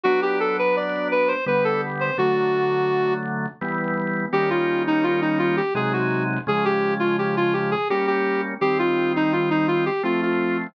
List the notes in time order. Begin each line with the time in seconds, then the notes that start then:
0.03 F#3 B3 D4 F#4
0.22 G4
0.40 A4
0.59 B4
0.76 D5
1.11 B4
1.28 C5
1.46 D3 G3 B3 B4
1.64 A4
2.00 C5
2.18 D3 F#3 A3 F#4
3.61 E3 G3 B3
4.33 D#3 G3 A#3 C#4 G4
4.50 F4
4.87 D#4
5.03 F4
5.22 D#4
5.39 F4
5.57 G4
5.75 C3 F#3 G#3 D#4 G#4
5.93 F#4
6.47 C#3 F3 G#3 G#4
6.65 G4
7.00 F4
7.18 G4
7.37 F4
7.53 G4
7.71 G#4
7.90 G3 A#3 C#4 G4
8.07 G4
8.61 D#3 G3 C4 G4
8.79 F4
9.16 D#4
9.33 F4
9.50 D#4
9.68 F4
9.86 G4
10.03 F3 A3 C4 F4
10.22 F4